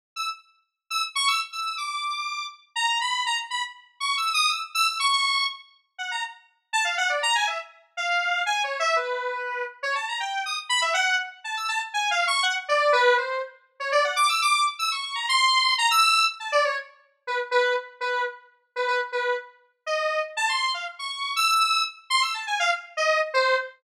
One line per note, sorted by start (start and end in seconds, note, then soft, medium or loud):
0.16 0.27 E6 medium
0.90 1.02 E6 medium
1.15 1.27 C#6 loud
1.28 1.39 E6 medium
1.52 1.75 E6 medium
1.78 2.45 D6 medium
2.76 2.98 A#5 loud
3.01 3.23 B5 medium
3.26 3.37 A#5 medium
3.50 3.62 B5 medium
4.00 4.15 C#6 medium
4.17 4.32 E6 medium
4.34 4.49 D#6 loud
4.49 4.60 E6 medium
4.75 4.86 E6 loud
4.87 4.98 E6 medium
5.00 5.44 C#6 loud
5.98 6.10 F#5 medium
6.11 6.22 A#5 medium
6.73 6.84 A5 loud
6.85 6.96 F5 medium
6.98 7.09 F#5 loud
7.09 7.21 D5 medium
7.23 7.34 A#5 loud
7.35 7.47 G#5 medium
7.47 7.58 E5 medium
7.97 8.42 F5 medium
8.46 8.61 G#5 medium
8.64 8.79 C#5 medium
8.80 8.94 E5 loud
8.96 9.63 B4 medium
9.83 9.94 C#5 medium
9.95 10.06 A5 medium
10.08 10.20 A#5 medium
10.20 10.42 G5 medium
10.46 10.57 D#6 medium
10.69 10.80 B5 loud
10.82 10.93 E5 medium
10.94 11.16 F#5 loud
11.44 11.55 A5 medium
11.57 11.68 E6 medium
11.68 11.80 A5 medium
11.94 12.09 G#5 medium
12.11 12.26 F5 loud
12.27 12.42 C#6 loud
12.43 12.54 F#5 loud
12.68 12.91 D5 loud
12.92 13.15 B4 loud
13.17 13.40 C5 medium
13.80 13.91 C#5 medium
13.92 14.03 D5 loud
14.04 14.15 F#5 medium
14.16 14.27 D6 loud
14.29 14.40 E6 medium
14.42 14.64 D6 loud
14.79 14.90 E6 medium
14.92 15.14 C#6 medium
15.15 15.26 A#5 medium
15.29 15.73 C6 loud
15.78 15.89 A#5 loud
15.91 16.24 E6 loud
16.40 16.51 A5 medium
16.52 16.63 D5 loud
16.65 16.76 C#5 medium
17.27 17.38 B4 medium
17.51 17.74 B4 loud
18.01 18.23 B4 medium
18.76 18.87 B4 medium
18.88 18.99 B4 medium
19.12 19.35 B4 medium
19.86 20.20 D#5 medium
20.37 20.48 A5 loud
20.49 20.71 C6 medium
20.74 20.85 F5 medium
20.99 21.32 C#6 medium
21.36 21.47 E6 loud
21.48 21.82 E6 loud
22.10 22.21 C6 loud
22.22 22.33 E6 medium
22.34 22.45 A5 medium
22.47 22.58 G#5 medium
22.60 22.71 F5 loud
22.97 23.19 D#5 loud
23.34 23.56 C5 loud